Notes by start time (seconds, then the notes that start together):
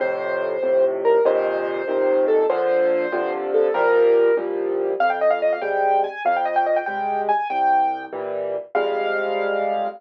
0.00 F2 A2 C3 C5
0.62 F2 A2 C3
1.05 A#4
1.25 F2 A#2 C3 D#3 C5
1.88 F2 A#2 C3 D#3
2.28 A4
2.50 A#2 D3 F3 C5
3.12 G2 C3 D3 F3
3.54 A4
3.74 C2 A#2 F3 G3 A#4
4.37 C2 A#2 F3 G3
5.00 F2 F5
5.10 G5
5.21 D#5
5.31 F5
5.42 D#5
5.53 F5
5.62 C3 G3 G#3 G5
6.04 G#5
6.25 F2 F5
6.36 G5
6.45 D#5
6.56 G5
6.66 D#5
6.76 G5
6.86 C3 G3 G#3 G5
7.29 G#5
7.50 C2 G5
8.13 A#2 E3 G3
8.75 F2 C3 G3 G#3 F5